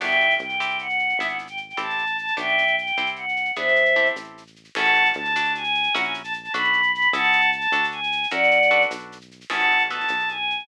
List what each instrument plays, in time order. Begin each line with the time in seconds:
0.00 synth bass 1 G1, acoustic guitar (steel) B3 D4 F#4 G4, choir aahs E5 G5, crash
0.11 shaker
0.20 shaker
0.30 shaker
0.39 synth bass 1 C2, choir aahs G5, shaker
0.49 shaker
0.60 acoustic guitar (steel) C4 E4 G4, shaker
0.70 shaker
0.79 choir aahs F#5, shaker
0.89 shaker
0.99 shaker
1.09 shaker
1.17 synth bass 1 G#1, acoustic guitar (steel) B3 D4 E4 G#4, choir aahs E5, shaker
1.28 choir aahs F#5, shaker
1.39 shaker
1.47 choir aahs G5, shaker
1.57 shaker
1.69 choir aahs G5, shaker
1.77 synth bass 1 A1, acoustic guitar (steel) C4 E4 G4 A4, choir aahs A5, shaker
1.90 shaker
1.98 shaker
2.07 shaker
2.17 choir aahs A5, shaker
2.27 shaker
2.37 synth bass 1 B1, acoustic guitar (steel) B3 D4 F#4 G4, choir aahs E5 G5, shaker
2.48 shaker
2.58 shaker
2.67 shaker
2.77 choir aahs G5, shaker
2.87 shaker
2.97 synth bass 1 C2, acoustic guitar (steel) C4 E4 G4, shaker
3.06 shaker
3.16 choir aahs F#5, shaker
3.29 shaker
3.36 shaker
3.45 shaker
3.56 synth bass 1 E2, acoustic guitar (steel) B3 D4 E4 G#4, choir aahs C5 E5, shaker
3.68 shaker
3.76 shaker
3.85 shaker
3.96 acoustic guitar (steel) C4 E4 G4 A4, shaker
4.06 shaker
4.16 synth bass 1 A1, shaker
4.24 shaker
4.38 shaker
4.47 shaker
4.56 shaker
4.64 shaker
4.75 synth bass 1 A1, acoustic guitar (steel) C#4 E4 G#4 A4, choir aahs F#5 A5, crash
4.85 shaker
4.94 shaker
5.05 shaker
5.13 synth bass 1 D2, choir aahs A5, shaker
5.25 shaker
5.35 acoustic guitar (steel) D4 F#4 A4, shaker
5.45 shaker
5.55 choir aahs G#5, shaker
5.64 shaker
5.75 shaker
5.83 shaker
5.94 synth bass 1 A#1, acoustic guitar (steel) C#4 E4 F#4 A#4, choir aahs F#5, shaker
6.04 choir aahs G#5, shaker
6.14 shaker
6.24 choir aahs A5, shaker
6.33 shaker
6.43 choir aahs A5, shaker
6.52 synth bass 1 B1, acoustic guitar (steel) D4 F#4 A4 B4, choir aahs B5, shaker
6.64 shaker
6.73 shaker
6.83 shaker
6.92 choir aahs B5, shaker
7.01 shaker
7.12 synth bass 1 C#2, acoustic guitar (steel) C#4 E4 G#4 A4, choir aahs F#5 A5, shaker
7.24 shaker
7.33 shaker
7.41 shaker
7.52 choir aahs A5, shaker
7.61 shaker
7.72 synth bass 1 D2, acoustic guitar (steel) D4 F#4 A4, shaker
7.84 shaker
7.91 choir aahs G#5, shaker
8.03 shaker
8.12 shaker
8.23 shaker
8.31 synth bass 1 F#2, acoustic guitar (steel) C#4 E4 F#4 A#4, choir aahs D5 F#5, shaker
8.43 shaker
8.51 shaker
8.62 shaker
8.71 acoustic guitar (steel) D4 F#4 A4 B4, shaker
8.82 shaker
8.91 synth bass 1 B1, shaker
8.99 shaker
9.12 shaker
9.21 shaker
9.31 shaker
9.41 shaker
9.50 synth bass 1 A1, acoustic guitar (steel) C#4 E4 G#4 A4, choir aahs F#5 A5, crash
9.60 shaker
9.71 shaker
9.79 shaker
9.90 acoustic guitar (steel) B3 D#4 F#4 A4, choir aahs A5, shaker
10.00 shaker
10.08 synth bass 1 B1, shaker
10.19 shaker
10.29 choir aahs G#5, shaker
10.50 shaker
10.59 shaker